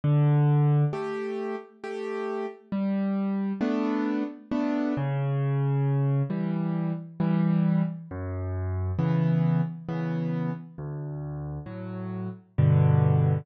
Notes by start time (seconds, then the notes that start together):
0.04 D3
0.93 A3 G4
1.84 A3 G4
2.72 G3
3.61 A3 B3 D4
4.51 A3 B3 D4
4.97 C#3
6.30 E3 G3
7.20 E3 G3
8.11 F#2
8.99 C#3 E3 B3
9.89 C#3 E3 B3
10.78 D2
11.66 A2 F#3
12.58 G2 B2 D3